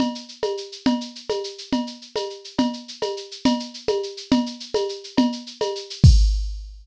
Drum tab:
CC |------|------|------|------|
SH |xxxxxx|xxxxxx|xxxxxx|xxxxxx|
CB |x--x--|x--x--|x--x--|x--x--|
CG |O--o--|O--o--|O--o--|O--o--|
BD |------|------|------|------|

CC |------|------|------|x-----|
SH |xxxxxx|xxxxxx|xxxxxx|------|
CB |x--x--|x--x--|x--x--|------|
CG |O--o--|O--o--|O--o--|------|
BD |------|------|------|o-----|